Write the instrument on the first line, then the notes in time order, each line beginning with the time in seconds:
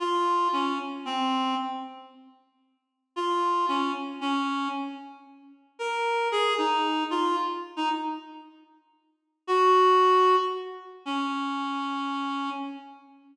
clarinet
0.00 F4
0.53 C#4
1.05 C4
3.16 F4
3.68 C#4
4.21 C#4
5.79 A#4
6.32 G#4
6.58 D#4
7.11 F4
7.76 D#4
9.47 F#4
11.05 C#4